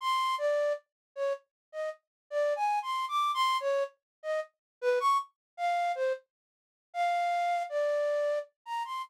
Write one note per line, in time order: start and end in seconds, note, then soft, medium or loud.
0.01 0.35 C6 medium
0.38 0.73 D5 medium
1.16 1.33 C#5 medium
1.72 1.90 D#5 medium
2.30 2.54 D5 medium
2.56 2.79 G#5 medium
2.82 3.05 C6 medium
3.08 3.31 D6 medium
3.34 3.57 C6 loud
3.60 3.83 C#5 loud
4.23 4.40 D#5 medium
4.81 4.99 B4 loud
5.00 5.17 C#6 loud
5.57 5.92 F5 medium
5.95 6.13 C5 medium
6.94 7.63 F5 medium
7.69 8.39 D5 medium
8.66 8.83 A#5 medium
8.85 9.02 C6 medium